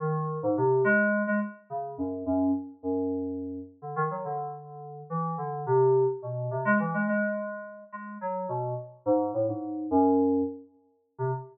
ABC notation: X:1
M:5/8
L:1/16
Q:1/4=106
K:none
V:1 name="Electric Piano 2" clef=bass
_E,3 _A,, C,2 _A,3 A, | z2 _D,2 _G,,2 G,,2 z2 | _G,,6 z D, _E, _G, | D,6 E,2 D,2 |
C,3 z B,,2 C, _A, E, A, | _A,6 A,2 _G,2 | B,,2 z2 _A,,2 =A,, _A,,3 | _G,,4 z5 C, |]